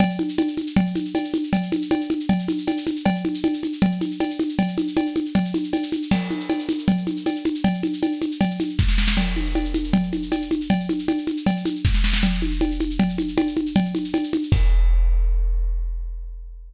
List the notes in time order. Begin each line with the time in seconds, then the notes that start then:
0.00 cowbell, low conga, shaker
0.10 shaker
0.19 high conga, shaker
0.29 shaker
0.38 cowbell, high conga, shaker
0.48 shaker
0.57 high conga, shaker
0.67 shaker
0.76 cowbell, low conga, shaker
0.86 shaker
0.95 high conga, shaker
1.05 shaker
1.15 cowbell, high conga, shaker
1.24 shaker
1.34 high conga, shaker
1.43 shaker
1.53 cowbell, low conga, shaker
1.63 shaker
1.72 high conga, shaker
1.82 shaker
1.91 cowbell, high conga, shaker
2.01 shaker
2.10 high conga, shaker
2.20 shaker
2.29 cowbell, low conga, shaker
2.39 shaker
2.48 high conga, shaker
2.58 shaker
2.67 cowbell, high conga, shaker
2.77 shaker
2.87 high conga, shaker
2.96 shaker
3.06 cowbell, low conga, shaker
3.15 shaker
3.25 high conga, shaker
3.34 shaker
3.44 cowbell, high conga, shaker
3.54 shaker
3.63 high conga, shaker
3.73 shaker
3.82 cowbell, low conga, shaker
3.92 shaker
4.01 high conga, shaker
4.11 shaker
4.20 cowbell, high conga, shaker
4.30 shaker
4.39 high conga, shaker
4.49 shaker
4.59 cowbell, low conga, shaker
4.68 shaker
4.78 high conga, shaker
4.87 shaker
4.97 cowbell, high conga, shaker
5.06 shaker
5.16 high conga, shaker
5.25 shaker
5.35 cowbell, low conga, shaker
5.45 shaker
5.54 high conga, shaker
5.63 shaker
5.73 cowbell, high conga, shaker
5.83 shaker
5.92 high conga, shaker
6.02 shaker
6.11 crash, cowbell, low conga, shaker
6.21 shaker
6.30 high conga, shaker
6.40 shaker
6.50 cowbell, high conga, shaker
6.59 shaker
6.69 high conga, shaker
6.78 shaker
6.88 cowbell, low conga, shaker
6.97 shaker
7.07 high conga, shaker
7.17 shaker
7.26 cowbell, high conga, shaker
7.35 shaker
7.45 high conga, shaker
7.55 shaker
7.64 cowbell, low conga, shaker
7.74 shaker
7.83 high conga, shaker
7.93 shaker
8.02 cowbell, high conga, shaker
8.12 shaker
8.22 high conga, shaker
8.31 shaker
8.41 cowbell, low conga, shaker
8.51 shaker
8.60 high conga, shaker
8.69 shaker
8.79 kick, snare
8.88 snare
8.98 snare
9.08 snare
9.17 crash, cowbell, low conga, shaker
9.27 shaker
9.36 high conga, shaker
9.46 shaker
9.55 cowbell, high conga, shaker
9.65 shaker
9.74 high conga, shaker
9.84 shaker
9.93 cowbell, low conga, shaker
10.03 shaker
10.13 high conga, shaker
10.22 shaker
10.32 cowbell, high conga, shaker
10.41 shaker
10.51 high conga, shaker
10.61 shaker
10.70 cowbell, low conga, shaker
10.80 shaker
10.89 high conga, shaker
10.99 shaker
11.08 cowbell, high conga, shaker
11.18 shaker
11.27 high conga, shaker
11.37 shaker
11.46 cowbell, low conga, shaker
11.56 shaker
11.65 high conga, shaker
11.75 shaker
11.85 kick, snare
11.94 snare
12.04 snare
12.13 snare
12.23 cowbell, low conga, shaker
12.33 shaker
12.42 high conga, shaker
12.52 shaker
12.61 cowbell, high conga, shaker
12.71 shaker
12.80 high conga, shaker
12.90 shaker
12.99 cowbell, low conga, shaker
13.09 shaker
13.18 high conga, shaker
13.28 shaker
13.38 cowbell, high conga, shaker
13.47 shaker
13.57 high conga, shaker
13.66 shaker
13.76 cowbell, low conga, shaker
13.85 shaker
13.95 high conga, shaker
14.04 shaker
14.14 cowbell, high conga, shaker
14.23 shaker
14.33 high conga, shaker
14.43 shaker
14.52 kick, crash